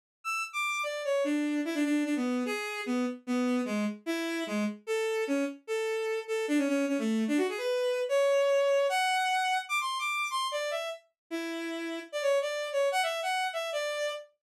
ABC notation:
X:1
M:2/4
L:1/16
Q:1/4=149
K:Emix
V:1 name="Violin"
z2 e'2 z d'3 | d2 c2 D4 | E D D2 D B,3 | G4 B,2 z2 |
B,4 G,2 z2 | E4 G,2 z2 | A4 C2 z2 | A6 A2 |
D C C2 C A,3 | D F G B5 | [K:Amix] c8 | f8 |
d' =c'2 d'3 c'2 | d2 e2 z4 | E8 | d c2 d3 c2 |
f e2 f3 e2 | d4 z4 |]